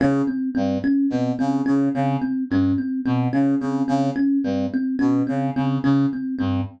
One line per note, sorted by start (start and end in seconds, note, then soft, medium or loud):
0.00 0.22 C#3 medium
0.00 0.23 C#4 medium
0.27 0.50 C4 medium
0.55 0.78 G2 medium
0.55 0.77 C4 medium
0.84 1.06 C#4 medium
1.10 1.32 B2 medium
1.10 1.34 C4 medium
1.39 1.62 C#3 medium
1.39 1.61 C4 medium
1.66 1.89 C#3 medium
1.66 1.88 C#4 medium
1.94 2.17 C#3 medium
1.94 2.17 C4 medium
2.22 2.44 C4 medium
2.50 2.73 G2 medium
2.50 2.74 C#4 medium
2.78 3.00 C4 medium
3.06 3.28 B2 medium
3.06 3.28 C4 medium
3.33 3.55 C#3 medium
3.33 3.55 C#4 medium
3.60 3.83 C#3 medium
3.60 3.84 C4 medium
3.88 4.10 C#3 medium
3.88 4.10 C4 medium
4.16 4.38 C#4 medium
4.44 4.66 G2 medium
4.44 4.67 C4 medium
4.74 4.96 C4 medium
4.99 5.22 B2 medium
4.99 5.21 C#4 medium
5.27 5.50 C#3 medium
5.27 5.49 C4 medium
5.56 5.78 C#3 medium
5.56 5.78 C4 medium
5.84 6.06 C#3 medium
5.84 6.06 C#4 medium
6.13 6.35 C4 medium
6.39 6.61 G2 medium
6.39 6.61 C4 medium